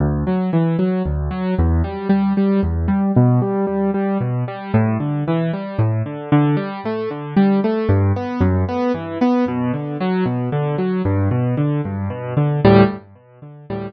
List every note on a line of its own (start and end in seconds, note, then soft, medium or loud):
0.00 0.24 D2 medium
0.27 0.51 F#3 medium
0.53 0.77 E3 medium
0.79 1.02 F#3 medium
1.06 1.29 D2 medium
1.31 1.54 F#3 medium
1.58 1.82 E2 medium
1.84 2.08 G3 medium
2.09 2.33 G3 medium
2.37 2.61 G3 medium
2.63 2.87 E2 medium
2.88 3.12 G3 medium
3.16 3.40 B2 medium
3.42 3.65 G3 medium
3.67 3.91 G3 medium
3.94 4.18 G3 medium
4.20 4.44 B2 medium
4.48 4.72 G3 medium
4.74 4.97 A2 medium
5.00 5.24 D3 medium
5.28 5.51 E3 medium
5.53 5.77 G3 medium
5.79 6.02 A2 medium
6.06 6.30 D3 medium
6.32 6.56 D3 medium
6.57 6.80 G3 medium
6.85 7.09 A3 medium
7.11 7.34 D3 medium
7.37 7.60 G3 medium
7.64 7.88 A3 medium
7.89 8.12 G2 medium
8.16 8.40 B3 medium
8.41 8.64 F#2 medium
8.69 8.92 B3 medium
8.94 9.18 E3 medium
9.21 9.45 B3 medium
9.48 9.72 B2 medium
9.73 9.97 D3 medium
10.00 10.24 F#3 medium
10.26 10.49 B2 medium
10.52 10.76 D3 medium
10.78 11.02 F#3 medium
11.05 11.29 G2 medium
11.31 11.55 B2 medium
11.57 11.81 D3 medium
11.85 12.09 G2 medium
12.10 12.34 B2 medium
12.37 12.60 D3 medium
12.65 12.83 D2 medium
12.65 12.83 A2 loud
12.65 12.83 G3 loud